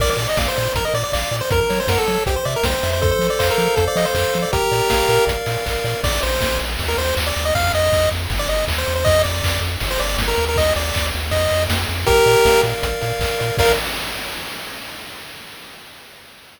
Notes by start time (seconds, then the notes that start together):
0.00 A#1 A#4 D5, kick, crash
0.10 D5
0.17 A#2 D5, open hi-hat
0.29 D#5
0.37 A#1 D5 F5, kick, snare
0.48 C5
0.57 A#2 D5, open hi-hat
0.75 A#1 A#4, kick, closed hi-hat
0.85 D#5
0.94 A#2 D5, open hi-hat
1.04 D5
1.12 A#1 D5 F5, kick, clap
1.31 A#2 D5, open hi-hat
1.41 C5
1.50 F#2 A#4, kick, closed hi-hat
1.61 A#4
1.69 F#3 C#5, open hi-hat
1.80 C5
1.87 F#2 A#4 F#5, kick, snare
1.98 A4
2.07 F#3 C#5, open hi-hat
2.26 C2 G4 C5, kick, closed hi-hat
2.36 C5
2.45 C3 D5 E5, open hi-hat
2.56 A#4
2.63 C2 C5 G5, kick, snare
2.83 F2 E5, open hi-hat
2.93 C5
3.01 A4 C5, kick, closed hi-hat
3.11 C5
3.19 F3 C5, open hi-hat
3.30 D5
3.39 F2 C5 F5, kick, clap
3.51 A#4
3.58 F3 A4, open hi-hat
3.76 F2 A4 C5, kick, closed hi-hat
3.87 D5
3.96 F3 D#5 F5, open hi-hat
4.06 C5
4.15 F2 A4 C5, kick, clap
4.34 F3 C5, open hi-hat
4.42 D5
4.53 A#1 G4 A#4, kick, closed hi-hat
4.71 A#2 D5, open hi-hat
4.90 A#1 F5, kick, snare
5.09 A#2 A#4, open hi-hat
5.27 A#1 D5, kick, closed hi-hat
5.46 A#2 F5, open hi-hat
5.66 A#1 A#4, kick, clap
5.84 A#2 D5, open hi-hat
6.04 A#1 D5, kick, crash
6.22 A#1 C5, ride
6.41 A#1, kick, snare
6.59 A#1, ride
6.79 D#2, kick, ride
6.88 A#4
6.98 D#2 C5, ride
7.16 D#2, kick, clap
7.27 D5
7.36 D#2, ride
7.45 D#5
7.55 F2 F5, kick, ride
7.74 F2 D#5, ride
7.92 F2, kick, clap
8.11 F2, ride
8.30 G1, kick, ride
8.39 D5
8.48 G1 D#5, ride
8.68 D#2, kick, clap
8.78 C5
8.86 E2, ride
8.96 C5
9.05 F2 D#5, kick, ride
9.24 F2 D5, ride
9.43 F2, kick, clap
9.61 F2, ride
9.80 G1, kick, ride
9.91 C5
9.99 G1 D5, ride
10.18 G1, kick, snare
10.28 A#4
10.38 D#2, ride
10.49 A#4
10.56 D#5, kick, ride
10.76 D#2 D5, ride
10.94 D#2, kick, clap
11.13 D#2, ride
11.31 F2 D#5, kick, ride
11.51 F2, ride
11.69 F2, kick, snare
11.89 F2, ride
12.06 A#1 G4 A#4, kick, closed hi-hat
12.26 A#2 D5, open hi-hat
12.45 A#1 F5, kick, snare
12.64 A#2 A#4, open hi-hat
12.83 A#1 D5, kick, closed hi-hat
13.01 A#2 F5, open hi-hat
13.19 A#1 A#4, kick, clap
13.39 A#2 D5, open hi-hat
13.57 A#1 A#4 D5 F5, kick, crash